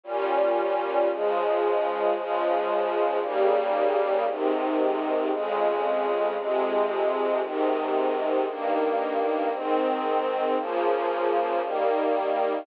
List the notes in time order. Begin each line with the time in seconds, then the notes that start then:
0.04 A#2 G3 C#4
1.09 C#3 F3 G#3
2.14 C#3 F3 G#3
3.20 D#2 C#3 G3 A#3
4.25 G#2 C3 D#3
5.29 F2 C#3 G#3
6.36 F2 C3 G#3
7.40 G#2 C3 D#3
8.46 G2 D#3 A#3
9.51 G#2 D#3 C4
10.56 C#3 F3 A#3
11.61 D#3 G3 A#3